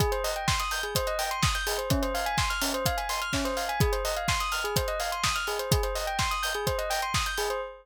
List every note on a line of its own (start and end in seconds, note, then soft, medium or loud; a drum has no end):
0.00 0.11 G#4 loud
0.00 kick medium
0.00 closed hi-hat medium
0.12 0.23 C5 medium
0.12 closed hi-hat medium
0.24 0.35 D#5 medium
0.24 open hi-hat medium
0.36 0.47 G5 medium
0.36 closed hi-hat medium
0.48 0.58 C6 medium
0.48 kick medium
0.48 snare loud
0.60 0.71 D#6 medium
0.60 closed hi-hat medium
0.71 0.82 G6 medium
0.71 open hi-hat medium
0.83 0.94 G#4 medium
0.83 closed hi-hat medium
0.95 1.06 C5 medium
0.95 kick medium
0.95 closed hi-hat loud
1.07 1.18 D#5 medium
1.07 closed hi-hat medium
1.19 1.30 G5 medium
1.19 open hi-hat medium
1.31 1.42 C6 medium
1.31 closed hi-hat medium
1.43 1.53 D#6 medium
1.43 kick medium
1.43 snare loud
1.55 1.66 G6 medium
1.55 closed hi-hat medium
1.67 1.77 G#4 medium
1.67 open hi-hat medium
1.78 1.89 C5 medium
1.78 closed hi-hat medium
1.90 2.01 C#4 loud
1.90 kick loud
1.90 closed hi-hat medium
2.02 2.13 C5 medium
2.02 closed hi-hat medium
2.14 2.25 F5 medium
2.14 open hi-hat medium
2.26 2.37 G#5 loud
2.26 closed hi-hat medium
2.38 2.49 C6 medium
2.38 kick medium
2.38 snare loud
2.50 2.61 F6 medium
2.50 closed hi-hat medium
2.62 2.72 C#4 medium
2.62 open hi-hat medium
2.74 2.85 C5 medium
2.74 closed hi-hat medium
2.86 2.97 F5 medium
2.86 kick medium
2.86 closed hi-hat loud
2.98 3.08 G#5 medium
2.98 closed hi-hat medium
3.09 3.20 C6 medium
3.09 open hi-hat medium
3.22 3.32 F6 medium
3.22 closed hi-hat medium
3.33 3.44 C#4 medium
3.33 kick medium
3.33 snare medium
3.45 3.56 C5 medium
3.45 closed hi-hat medium
3.57 3.68 F5 medium
3.57 open hi-hat medium
3.69 3.80 G#5 medium
3.69 closed hi-hat medium
3.80 3.91 G#4 loud
3.80 kick loud
3.80 closed hi-hat medium
3.92 4.03 C5 medium
3.92 closed hi-hat medium
4.05 4.15 D#5 medium
4.05 open hi-hat medium
4.16 4.27 F5 medium
4.16 closed hi-hat medium
4.28 4.39 C6 medium
4.28 kick medium
4.28 snare loud
4.40 4.51 D#6 medium
4.40 closed hi-hat medium
4.52 4.63 F6 medium
4.52 open hi-hat medium
4.64 4.75 G#4 medium
4.64 closed hi-hat medium
4.76 4.87 C5 medium
4.76 kick medium
4.76 closed hi-hat loud
4.88 4.99 D#5 medium
4.88 closed hi-hat medium
5.00 5.11 F5 medium
5.00 open hi-hat medium
5.12 5.23 C6 medium
5.12 closed hi-hat medium
5.24 5.34 D#6 medium
5.24 kick medium
5.24 snare loud
5.36 5.46 F6 medium
5.36 closed hi-hat medium
5.47 5.58 G#4 medium
5.47 open hi-hat medium
5.59 5.70 C5 medium
5.59 closed hi-hat medium
5.71 5.82 G#4 medium
5.71 kick loud
5.71 closed hi-hat loud
5.83 5.94 C5 medium
5.83 closed hi-hat medium
5.95 6.06 D#5 medium
5.95 open hi-hat medium
6.07 6.18 G5 medium
6.07 closed hi-hat medium
6.19 6.30 C6 medium
6.19 kick medium
6.19 snare medium
6.31 6.42 D#6 medium
6.31 closed hi-hat medium
6.43 6.53 G6 medium
6.43 open hi-hat medium
6.54 6.66 G#4 medium
6.54 closed hi-hat medium
6.67 6.77 C5 medium
6.67 kick medium
6.67 closed hi-hat medium
6.78 6.89 D#5 medium
6.78 closed hi-hat medium
6.90 7.01 G5 medium
6.90 open hi-hat medium
7.02 7.13 C6 medium
7.02 closed hi-hat medium
7.14 7.25 D#6 medium
7.14 kick medium
7.14 snare loud
7.26 7.37 G6 medium
7.26 closed hi-hat medium
7.37 7.49 G#4 medium
7.37 open hi-hat medium
7.50 7.61 C5 medium
7.50 closed hi-hat medium